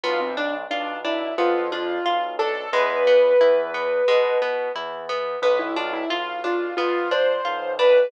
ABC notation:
X:1
M:4/4
L:1/16
Q:1/4=89
K:Am
V:1 name="Acoustic Grand Piano"
F C D z D2 E2 F2 F4 A2 | B10 z6 | B E F E F2 F2 F2 c4 B2 |]
V:2 name="Orchestral Harp"
B,2 D2 F2 D2 B,2 D2 F2 D2 | ^G,2 B,2 E2 B,2 G,2 B,2 E2 B,2 | B,2 D2 F2 D2 B,2 D2 F2 D2 |]
V:3 name="Acoustic Grand Piano" clef=bass
B,,,4 B,,,4 F,,4 B,,,4 | E,,4 E,,4 B,,4 E,,4 | B,,,4 B,,,4 F,,4 B,,,4 |]